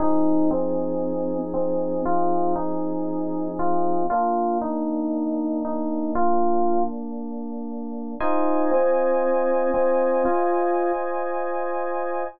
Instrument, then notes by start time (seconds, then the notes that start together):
electric piano 2
0.00 F3 C4 D#4 G#4
0.51 C4
1.54 C4
2.06 F4
2.56 D#4
3.59 F4
4.10 A#3 D4 F4
4.62 D#4
5.65 D#4
6.15 F4
8.20 D#4 F4 C5 D#5 G#5
8.71 C4
9.74 C4
10.25 F4